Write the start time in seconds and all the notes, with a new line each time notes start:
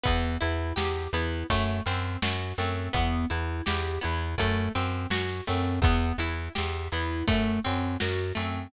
0.04 E2 B3, kick, closed hi-hat
0.41 E2 E4, closed hi-hat
0.76 E2 G4, snare
1.13 E2 B3 E4, closed hi-hat
1.50 F#2 A3, kick, closed hi-hat
1.86 F#2 C4, closed hi-hat
2.22 F#2 F#4, snare
2.58 F#2 A3 C4, closed hi-hat
2.93 E2 B3, kick, closed hi-hat
3.30 E2 E4, closed hi-hat
3.66 E2 G4, snare
4.01 E2 B3 E4, closed hi-hat
4.38 F#2 A3, kick, closed hi-hat
4.75 F#2 C4, closed hi-hat
5.10 F#2 F#4, snare
5.47 F#2 A3 C4, closed hi-hat
5.82 E2 B3, kick, closed hi-hat
6.18 E2 E4, closed hi-hat
6.55 E2 G4, snare
6.92 E2 B3 E4, closed hi-hat
7.28 F#2 A3, kick, closed hi-hat
7.64 F#2 C4, closed hi-hat
8.00 F#2 F#4, snare
8.35 F#2 A3 C4, closed hi-hat